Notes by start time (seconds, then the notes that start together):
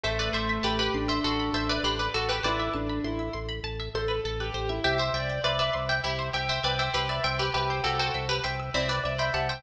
0.04 A1 A3 A4 C5 E5
0.19 B4 D5
0.33 A1 C5 E5
0.49 E5
0.63 A1 G4 B4 A5
0.79 G4 B4 B5
0.94 A1 D4 C6
1.08 C5 E5 E6
1.24 A1 F#4 A4 C6
1.39 B5
1.53 A1 C5 E5 A5
1.69 B4 D5 E5
1.83 A1 G4 B4 C5
1.99 B4 D5
2.14 A1 F#4 A4
2.29 G4 B4
2.43 A1 E4 B4 C5 D5
2.59 E5
2.73 A1 D4 A5
2.89 B5
3.04 A1 E4 C6
3.19 E4 E6
3.33 A1 C6
3.49 B5
3.64 A1 A5
3.79 E5
3.94 A1 A4 C5
4.08 B4
4.24 A1 A4
4.40 G4 B4
4.54 A1 C5
4.69 E4 E5
4.84 C2 G4 E5 G5
4.98 C5 E5
5.14 C2 D5 E5 G5
5.29 G5
5.44 C2 B4 D5 E5 C6
5.59 B4 D5 E5 E6
5.73 C2 C6
5.89 E5 G5
6.04 C2 E4 G4 E5
6.19 C5
6.33 C2 G4 E5 G5
6.49 C5 E5
6.63 C2 B4 D5 E5 G5
6.79 C5 E5 G5
6.94 C2 G4 B4 C6
7.09 B4 D5 E5 E6
7.24 C2 E5 G5 C6
7.39 G4 B4 G5
7.54 C2 G4 B4 E5 G5
7.70 C5
7.84 C2 F#4 G4 A4 G5
7.99 F#4 A4 C5 G5
8.14 C2 E5
8.29 G4 B4 G5
8.44 C2 E5 G5 C6
8.60 E6
8.74 C2 C4 E4 D5 C6
8.88 B4 D5 G5
9.04 C2 D5 E5
9.18 C5 E5 G5 B5
9.34 C2 G4 F#5 A5
9.49 C5 E5 G5